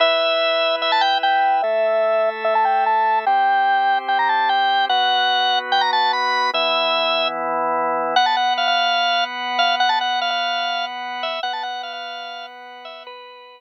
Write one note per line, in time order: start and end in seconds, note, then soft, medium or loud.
0.00 1.61 E4 medium
0.00 1.61 B4 medium
0.00 1.61 E5 medium
0.00 0.76 E5 medium
0.82 0.91 E5 medium
0.92 1.02 A5 medium
1.01 1.18 G5 medium
1.23 1.62 G5 medium
1.62 3.25 A3 medium
1.62 3.25 A4 medium
1.62 2.29 E5 medium
1.62 3.25 E5 medium
2.44 2.54 E5 medium
2.55 2.65 A5 medium
2.65 2.84 G5 medium
2.86 3.19 A5 medium
3.26 4.88 C4 medium
3.26 4.88 G4 medium
3.26 4.88 C5 medium
3.26 3.98 G5 medium
4.08 4.18 G5 medium
4.19 4.28 A#5 medium
4.29 4.49 A5 medium
4.49 4.85 G5 medium
4.89 6.51 B3 medium
4.89 6.51 F#4 medium
4.89 6.51 B4 medium
4.89 5.59 F#5 medium
5.72 5.82 G5 medium
5.81 5.91 A#5 medium
5.93 6.12 A5 medium
6.13 6.50 B5 medium
6.53 8.15 E3 medium
6.53 8.15 B3 medium
6.53 8.15 E4 loud
6.53 7.28 E5 medium
8.16 11.39 B3 medium
8.16 11.39 B4 medium
8.16 8.26 F#5 medium
8.16 11.39 F#5 medium
8.26 8.36 A5 medium
8.37 8.54 F#5 medium
8.58 8.67 F5 medium
8.68 9.24 F5 medium
9.59 9.75 F5 medium
9.80 9.90 F#5 medium
9.89 9.99 A5 medium
10.01 10.20 F#5 medium
10.21 10.30 F5 medium
10.30 10.85 F5 medium
11.23 11.41 E5 medium
11.43 13.61 B3 medium
11.43 13.61 B4 medium
11.43 11.53 F#5 medium
11.43 13.61 F#5 medium
11.53 11.63 A5 medium
11.63 11.82 F#5 medium
11.83 11.93 F5 medium
11.93 12.46 F5 medium
12.85 13.03 E5 medium
13.07 13.60 B4 medium